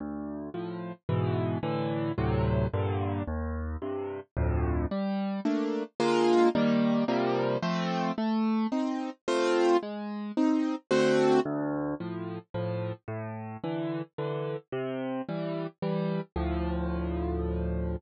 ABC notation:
X:1
M:3/4
L:1/8
Q:1/4=110
K:Dm
V:1 name="Acoustic Grand Piano"
D,,2 [A,,F,]2 [^G,,=B,,E,]2 | [A,,D,E,]2 [D,,A,,C,^F,]2 [G,,B,,D,]2 | _E,,2 [G,,C,]2 [D,,F,,A,,]2 | [K:Gm] G,2 [A,B,D]2 [D,_A,B,F]2 |
[E,G,B,]2 [C,F,G,B,]2 [F,A,C]2 | A,2 [CE]2 [A,CF]2 | _A,2 [CE]2 [D,=A,C^F]2 | [K:Dm] D,,2 [A,,F,]2 [A,,F,]2 |
A,,2 [D,E,]2 [D,E,]2 | C,2 [E,G,]2 [E,G,]2 | [D,,A,,F,]6 |]